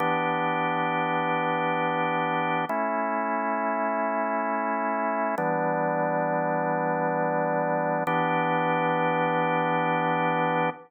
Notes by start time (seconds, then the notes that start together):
0.00 E3 B3 D4 G4
2.69 A3 C#4 E4
5.38 E3 G3 B3 D4
8.07 E3 B3 D4 G4